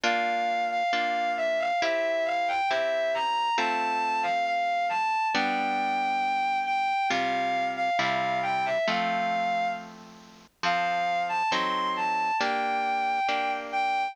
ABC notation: X:1
M:4/4
L:1/16
Q:1/4=68
K:F
V:1 name="Violin"
f3 f f2 e f e2 f g e2 b2 | a3 f f2 a2 g6 g2 | f3 f f2 g e f4 z4 | f3 a c'2 a2 g6 g2 |]
V:2 name="Orchestral Harp"
[B,DF]4 [B,DF]4 [CEG]4 [CEG]4 | [A,CF]8 [G,=B,D]8 | [C,G,F]4 [C,G,E]4 [F,A,C]8 | [F,CA]4 [^F,C_EA]4 [B,DG]4 [B,DG]4 |]